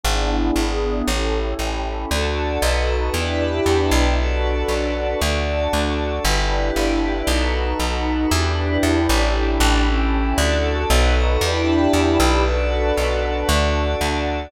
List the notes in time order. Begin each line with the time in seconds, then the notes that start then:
0.03 G#1 B3 D4 E4 G#4
0.56 G#1
1.07 A1 C#4 E4 G4 A4
1.59 A1
2.10 D2 D4 F#4 A4 D5
2.62 B1 D#4 F#4 A4 B4 D#5
3.14 E2 D4 E4 G4 B4 D5 E5
3.66 E2
3.91 B1
4.18 D4 F#4 A4 B4 D5
4.68 B1
5.21 D2 D4 F#4 A4 D5
5.73 D2
6.24 G1 D4 E4 G4 B4 D5
6.76 G1
7.27 B1 D#4 F#4 A4 B4
7.79 B1
8.31 E2 D4 E4 G4 B4
8.83 E2
9.09 A1
9.34 D4 E4 G4 A4
9.60 A1
9.87 C#4 E4 G4 A4
10.38 D2 D4 F#4 A4 D5
10.90 B1 D#4 F#4 A4 B4 D#5
11.41 E2 D4 E4 G4 B4 D5 E5
11.93 E2
12.20 B1
12.45 D4 F#4 A4 B4 D5
12.97 B1
13.48 D2 D4 F#4 A4 D5
14.01 D2